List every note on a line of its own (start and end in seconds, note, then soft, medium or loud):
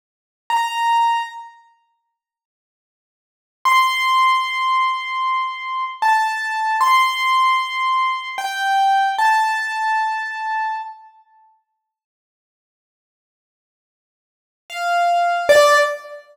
0.50 1.23 A#5 medium
3.65 5.84 C6 medium
6.02 6.76 A5 medium
6.81 8.29 C6 medium
8.38 9.09 G5 medium
9.18 10.75 A5 medium
14.70 15.48 F5 medium
15.49 15.77 D5 loud